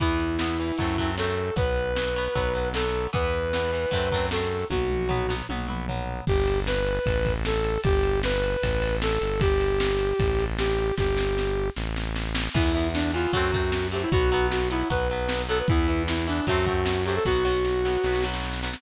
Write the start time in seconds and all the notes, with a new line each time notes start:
0.00 E2 E3 B3 E4, kick, closed hi-hat
0.20 closed hi-hat
0.39 E3 B3, snare
0.59 E3 B3, closed hi-hat
0.78 F#2 F#3 A3, kick, closed hi-hat
0.82 C4
0.98 F#3 A3, kick, closed hi-hat
1.02 C4
1.18 F#3 A3 C4 A4, snare
1.37 closed hi-hat
1.56 B1 F#3 B3 B4, kick, closed hi-hat
1.76 closed hi-hat
1.96 F#3 B3, snare
2.16 F#3 B3, closed hi-hat
2.35 B1 F#3 B3, kick, closed hi-hat
2.54 F#3 B3, closed hi-hat
2.74 F#3 B3 A4, snare
2.95 closed hi-hat
3.13 E2 E3 B3 B4, kick, closed hi-hat
3.34 closed hi-hat
3.53 E3 B3, snare
3.73 E3 B3, closed hi-hat
3.91 F#2 F#3 A3 C4, kick, closed hi-hat
4.11 F#3 A3, kick, closed hi-hat
4.16 C4
4.31 F#3 A3 A4, snare
4.35 C4
4.50 closed hi-hat
4.70 B1 F#3 B3 F#4, kick, high tom
4.90 mid tom
5.09 F#3 B3, floor tom
5.29 F#3 B3, snare
5.49 B1 F#3 B3, high tom
5.68 F#3 B3, mid tom
5.88 F#3 B3, floor tom
6.27 G1 G4, kick, crash
6.47 ride
6.67 B4, snare
6.86 ride
7.06 A1, kick, ride
7.26 kick, ride
7.45 A4, snare
7.64 ride
7.84 G1 G4, kick, ride
8.04 ride
8.23 B4, snare
8.43 ride
8.63 A1, kick, ride
8.82 ride
9.02 A4, snare
9.21 G1, ride
9.41 G4, kick, ride
9.61 ride
9.80 snare
9.99 ride
10.20 A1, kick, ride
10.39 ride
10.58 G4, snare
10.78 ride
10.98 G1 G4, kick, snare
11.17 snare
11.38 snare
11.76 A1, snare
11.96 snare
12.16 snare
12.35 snare
12.54 E2 E3 B3 E4, kick, crash
12.75 E3 B3, closed hi-hat
12.94 D4, snare
13.13 E3 B3 F4, closed hi-hat
13.33 F#2 F#3 A3 C4 F#4, kick, closed hi-hat
13.52 F#3 A3 C4, kick, closed hi-hat
13.72 snare
13.92 F#3 A3 G4, open hi-hat
13.96 C4
14.02 E4
14.12 B1 F#3 B3 F#4, kick, closed hi-hat
14.32 F#3 B3, closed hi-hat
14.51 F#4, snare
14.70 F#3 B3 E4, closed hi-hat
14.90 B1 F#3 B3 B4, kick, closed hi-hat
15.10 F#3 B3, closed hi-hat
15.29 snare
15.49 F#3 B3 A4, closed hi-hat
15.59 B4
15.68 E2 E3 B3 E4, kick, closed hi-hat
15.88 E3 B3, closed hi-hat
16.08 E4, snare
16.27 E3 B3 D4, closed hi-hat
16.47 F#2 F#3 A3 F#4, kick, closed hi-hat
16.51 C4
16.66 F#3 A3, kick, closed hi-hat
16.70 C4
16.86 snare
17.05 F#3 A3 C4 G4, closed hi-hat
17.16 A4
17.25 B1 F#3 B3 F#4, kick, snare
17.45 F#3 B3, snare
17.65 snare
17.85 F#3 B3, snare
18.04 B1 F#3 B3, snare
18.13 snare
18.23 F#3 B3, snare
18.33 snare
18.43 snare
18.53 snare
18.63 F#3 B3, snare
18.73 snare